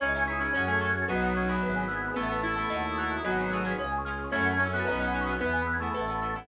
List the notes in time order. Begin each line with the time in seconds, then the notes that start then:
0.00 C#2 C#4 D#4 E4 G#4 C#5
0.09 D#5
0.14 C#4 D#4 E4 G#4 E5
0.21 G#5
0.27 C#4 D#4 E4 G#4 C#6
0.33 D#6
0.39 C#4 D#4 E4 G#4 E6
0.48 G#6
0.53 F#2 C#4 F#4 G#4 A4 C#5
0.60 F#5
0.67 A3 G#5
0.75 A5
0.81 C#4 F#4 G#4 A4 C#6
0.89 F#6 G#6
1.02 A6
1.08 B1 F#3 B3 D#4 F#4 B4
1.15 D#5
1.22 B3 D#4 F#4 F#5
1.28 B5
1.35 B3 C#4 D#4 F#4 D#6
1.42 F#6
1.48 B3 E4 G#4 D#6
1.55 B5
1.61 G#1 B3 E4 G#4 B4
1.69 E5
1.76 G#5
1.82 B5
1.88 B3 E4 G#4 E6
1.96 G#6
2.02 E6
2.08 B5
2.14 A1 A3 B3 E4 A4 B4
2.23 E5
2.29 B3 E4 A4 A5
2.38 B5 E6
2.43 B3 E4 A4
2.50 A6
2.56 A3 B3 E4 A4 E6
2.64 B5
2.69 D#2 D#4 F#4 A4 D#5
2.76 F#5
2.85 A5
2.91 D#6
2.98 D#4 F#4 A4 F#6
3.02 A6
3.11 F#6
3.17 D#6
3.24 G#1 F#3 B3 D#4 F#4 G#4 B4 D#5
3.31 F#5
3.38 D#4 F#4 G#4 B4 G#5
3.44 B5
3.51 A3 D#4 F#4 G#4 B4 D#6
3.57 F#6
3.65 C#4 F4 G#4 G#6
3.71 B6
3.77 C#2 G#3 C#4 F4 G#4 C#5
3.84 F5
3.92 G#5
3.98 C#6
4.05 C#4 F4 G#4 F6
4.11 G#6
4.18 F6
4.24 C#6
4.32 F#2 A3 C#4 E4 F#4 A4 C#5
4.40 E5
4.45 F#5
4.53 A5
4.59 C#4 C#6
4.65 E6
4.73 B3 C#4 E4 F#4 A4 F#6
4.80 A6
4.85 B1 B3 C#4 D#4 F#4 B4
4.89 B3 C#5
4.99 B3 C#4 D#4 F#4 D#5
5.08 F#5
5.12 B3 C#4 D#4 F#4 B5
5.21 C#6
5.27 B3 E4 G#4 D#6
5.33 F#6
5.39 E2 B3 E4 G#4 B4
5.46 E5
5.53 G#5
5.62 B5
5.67 E6
5.73 G#6
5.80 A3 B3 E4 G#4 E6
5.87 B5
5.94 A1 B3 E4 A4 B4
6.01 E5
6.08 B3 E4 A4 A5
6.15 B5
6.22 B3 E4 A4 E6
6.29 A6
6.35 B3 E4 A4 E6
6.42 B5